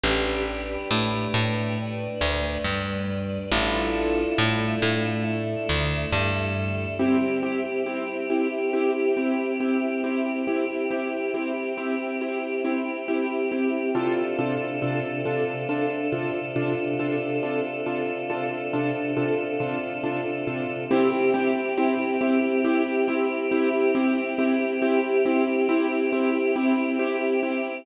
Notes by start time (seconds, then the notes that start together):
0.03 A1 D4 G4 B4
0.91 A2 A3
1.34 A2 A3
1.78 D4 B4 D5
2.21 D2 D3
2.64 G2 G3
3.51 A1 D4 E4 F4 A4
4.38 A2 A3
4.82 A2 A3
5.24 A3 D4 E4 A4
5.69 D2 D3
6.12 G2 G3
6.99 C4 E4 G4
7.43 C4 E4 G4
7.86 C4 E4 G4
8.30 C4 E4 G4
8.73 C4 E4 G4
9.17 C4 E4 G4
9.60 C4 E4 G4
10.04 C4 E4 G4
10.47 C4 E4 G4
10.91 C4 E4 G4
11.34 C4 E4 G4
11.78 C4 E4 G4
12.21 C4 E4 G4
12.64 C4 E4 G4
13.08 C4 E4 G4
13.52 C4 E4 G4
13.95 C3 D4 F4 A4
14.39 C3 D4 F4 A4
14.82 C3 D4 F4 A4
15.25 C3 D4 F4 A4
15.69 C3 D4 F4 A4
16.12 C3 D4 F4 A4
16.56 C3 D4 F4 A4
16.99 C3 D4 F4 A4
17.43 C3 D4 F4 A4
17.86 C3 D4 F4 A4
18.30 C3 D4 F4 A4
18.73 C3 D4 F4 A4
19.17 C3 D4 F4 A4
19.60 C3 D4 F4 A4
20.03 C3 D4 F4 A4
20.47 C3 D4 F4 A4
20.91 C4 E4 G4
21.34 C4 E4 G4
21.78 C4 E4 G4
22.21 C4 E4 G4
22.64 C4 E4 G4
23.08 C4 E4 G4
23.51 C4 E4 G4
23.95 C4 E4 G4
24.38 C4 E4 G4
24.82 C4 E4 G4
25.25 C4 E4 G4
25.69 C4 E4 G4
26.12 C4 E4 G4
26.56 C4 E4 G4
26.99 C4 E4 G4
27.43 C4 E4 G4